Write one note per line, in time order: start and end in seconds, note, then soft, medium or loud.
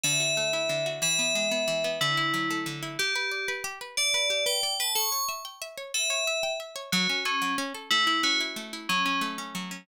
0.03 0.69 D3 medium
0.03 0.86 E5 loud
0.20 0.86 F#4 medium
0.37 0.99 A3 medium
0.53 1.00 E4 medium
0.69 1.00 D3 medium
0.86 1.02 F#4 medium
1.02 1.67 E3 medium
1.02 1.90 E5 loud
1.19 1.51 B3 medium
1.35 1.98 G#3 medium
1.51 1.84 B3 medium
1.68 1.99 E3 medium
1.84 2.00 B3 medium
2.01 2.66 D3 medium
2.01 2.58 E4 loud
2.17 2.82 E4 medium
2.34 2.96 F#3 medium
2.50 2.97 A3 medium
2.66 2.97 D3 medium
2.83 2.98 E4 medium
2.99 3.52 G4 loud
2.99 3.14 G4 loud
3.16 3.30 B4 medium
3.31 3.46 D5 medium
3.48 3.63 B4 medium
3.64 3.79 G4 loud
3.81 3.96 B4 medium
3.97 4.44 D5 loud
3.97 4.13 D5 medium
4.14 4.29 B4 medium
4.30 4.45 G4 medium
4.46 4.61 B4 medium
4.46 4.74 G5 medium
4.63 4.78 D5 medium
4.80 4.95 B4 medium
4.80 4.93 A5 medium
4.95 5.10 A4 loud
4.95 5.24 C#6 loud
5.12 5.27 C#5 medium
5.29 5.43 E5 medium
5.45 5.60 G5 medium
5.62 5.76 E5 medium
5.77 5.92 C#5 medium
5.94 6.09 A4 medium
5.94 6.51 E5 loud
6.10 6.25 C#5 medium
6.27 6.42 E5 medium
6.43 6.58 G5 medium
6.60 6.75 E5 medium
6.76 6.90 C#5 medium
6.92 7.08 F#3 loud
6.92 7.19 F#4 loud
7.09 7.24 C#4 medium
7.25 7.53 C#4 loud
7.25 7.40 A4 medium
7.42 7.56 F#3 medium
7.58 7.73 C#4 loud
7.74 7.89 A4 medium
7.91 8.56 A3 medium
7.91 8.04 E4 loud
8.07 8.40 E4 medium
8.07 8.21 E4 loud
8.23 8.86 C#4 medium
8.23 8.39 F#4 loud
8.40 8.73 E4 medium
8.56 8.87 A3 medium
8.73 8.89 E4 medium
8.89 9.54 F#3 medium
8.89 9.03 C#4 loud
9.06 9.38 C#4 medium
9.06 9.20 C#4 loud
9.21 9.84 A3 medium
9.38 9.71 C#4 medium
9.55 9.86 F#3 medium
9.71 9.87 C#4 medium